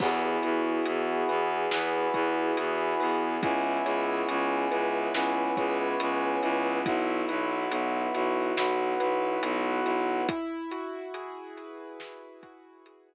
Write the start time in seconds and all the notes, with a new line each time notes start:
0.00 E2 B3 E4 F#4 G#4, kick, crash
0.43 E2 F#4, closed hi-hat
0.85 E2 G#4, closed hi-hat
1.29 E2 B4, closed hi-hat
1.71 E2 B3 E4 G#4 B4, snare
2.14 E2 F#4, kick, closed hi-hat
2.57 E2 G#4, closed hi-hat
3.00 E2 B4, open hi-hat
3.42 C#2 B3 C#4 E4 G#4, kick, closed hi-hat
3.85 C#2 C#5, closed hi-hat
4.29 C#2 E4, closed hi-hat
4.71 C#2 B4, closed hi-hat
5.14 C#2 B3 C#4 E4 G#4 B4, snare
5.57 C#2 C#5, kick, closed hi-hat
6.00 C#2 B4, closed hi-hat
6.43 C#2 E4, closed hi-hat
6.85 B1 B3 E4 F#4, kick, closed hi-hat
7.29 B1 B4, closed hi-hat
7.70 B1 E4, closed hi-hat
8.14 B1 F#4, closed hi-hat
8.57 B1 B3 E4 F#4 B4, snare
9.00 B1 B4, closed hi-hat
9.43 B1 F#4, closed hi-hat
9.85 B1 E4, closed hi-hat
10.29 E4, kick, closed hi-hat
10.71 F#4, closed hi-hat
11.14 G#4, closed hi-hat
11.57 B4, closed hi-hat
12.00 E4, snare
12.43 F#4, kick, closed hi-hat
12.86 G#4, closed hi-hat